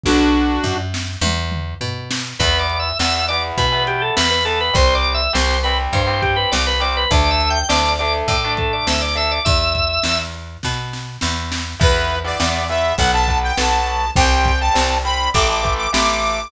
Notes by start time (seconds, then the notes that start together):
0.04 B1 D4 F#4, kick, high tom
0.64 F#2, floor tom
0.94 snare
1.21 E2, high tom
1.52 mid tom
1.81 B2, floor tom
2.11 snare
2.39 E2 E3 B3 B4, kick, crash
2.59 D5
2.70 closed hi-hat
2.79 E5
2.99 E2 E3 B3 E5, snare
3.28 E3 B3 D5, closed hi-hat
3.58 B2 B4, kick, closed hi-hat
3.72 E3 B3
3.87 G4, closed hi-hat
4.02 A4
4.17 E2 B4, snare
4.31 B4
4.45 E3 B3 A4, closed hi-hat
4.61 B4
4.74 C2 G3 C4 C5, kick, closed hi-hat
4.95 D5
5.05 closed hi-hat
5.14 E5
5.33 C2 G3 C4 C5, snare
5.63 G3 C4 B4, closed hi-hat
5.93 G2 C5, kick, closed hi-hat
6.07 G3 C4
6.22 G4, kick, closed hi-hat
6.36 B4
6.52 C2 D5, snare
6.67 B4
6.80 G3 C4 D5, closed hi-hat
6.97 B4
7.11 D2 A3 D4 D5, kick, closed hi-hat
7.31 E5
7.41 closed hi-hat
7.50 G5
7.69 D2 A3 D4 D5, snare
7.99 A3 D4 D5, closed hi-hat
8.28 A2 D5, kick, closed hi-hat
8.44 A3 D4
8.57 A4, kick, closed hi-hat
8.73 D5
8.87 D2 E5, snare
9.02 D5
9.15 A3 D4 E5, closed hi-hat
9.31 D5
9.45 E2 E5, kick, closed hi-hat
9.75 kick, closed hi-hat
10.03 E2, snare
10.34 closed hi-hat
10.63 B2, kick, snare
10.93 snare
11.21 E2, snare
11.52 snare
11.80 E2 E3 B3 B4, kick, crash
12.10 closed hi-hat
12.24 E3 B3 D5
12.40 E2 E3 B3, snare
12.69 E3 B3 E5, closed hi-hat
12.98 B1 F#3 B3 F#5, kick, closed hi-hat
13.13 F#3 B3 A5
13.28 F#3 B3, kick, closed hi-hat
13.43 G5
13.57 B1 F#3 B3 A5, snare
13.86 closed hi-hat
14.16 C2 G3 C4 G5, kick, closed hi-hat
14.45 kick, closed hi-hat
14.60 G3 C4 A5
14.74 C2 G3 C4, snare
15.04 G3 C4 B5, closed hi-hat
15.34 A1 E3 A3 D6, kick, closed hi-hat
15.49 E3 A3 D6
15.63 E3 A3, kick, closed hi-hat
15.77 D6
15.93 A1 E3 A3 D6, snare
16.23 open hi-hat